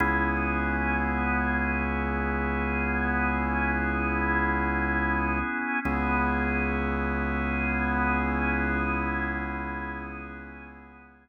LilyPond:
<<
  \new Staff \with { instrumentName = "Drawbar Organ" } { \time 4/4 \key cis \dorian \tempo 4 = 82 <b cis' e' gis'>1~ | <b cis' e' gis'>1 | <b cis' e' gis'>1~ | <b cis' e' gis'>1 | }
  \new Staff \with { instrumentName = "Synth Bass 2" } { \clef bass \time 4/4 \key cis \dorian cis,1~ | cis,1 | cis,1~ | cis,1 | }
>>